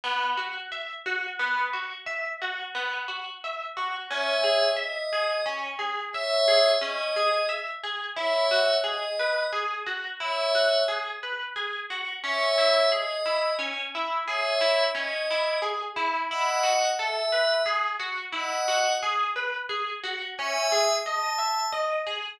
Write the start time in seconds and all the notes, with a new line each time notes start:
0.04 B3
0.37 F#4
0.72 E5
1.06 F#4
1.39 B3
1.73 F#4
2.06 E5
2.42 F#4
2.75 B3
3.08 F#4
3.44 E5
3.77 F#4
4.11 C#4 C#5 E5
4.44 G#4
4.77 D#5 E5
5.13 G#4
5.46 C#4
5.79 G#4
6.13 C#5 E5
6.48 G#4
6.81 C#4 D#5
7.16 G#4
7.49 E5
7.83 G#4
8.17 E4 C#5 E5
8.51 F#4
8.84 G#4 D#5
9.19 B4
9.53 G#4
9.86 F#4
10.20 E4 C#5 E5
10.55 F#4
10.88 G#4
11.23 B4
11.56 G#4
11.90 F#4
12.24 C#4 C#5 E5
12.58 E4
12.92 G#4 D#5
13.26 E4
13.59 C#4
13.95 E4
14.27 G#4 C#5 E5
14.61 E4
14.95 C#4 D#5
15.31 E4
15.62 G#4
15.96 E4
16.30 E4 D#5 F#5
16.63 F#4
16.98 A4 E5
17.32 B4
17.66 G#4
18.00 F#4
18.32 E4 D#5 F#5
18.68 F#4
19.03 G#4
19.36 B4
19.69 G#4
20.04 F#4
20.38 C#4 E5 G#5
20.72 G#4
21.05 D#5 A5
21.38 E5
21.72 D#5
22.07 G#4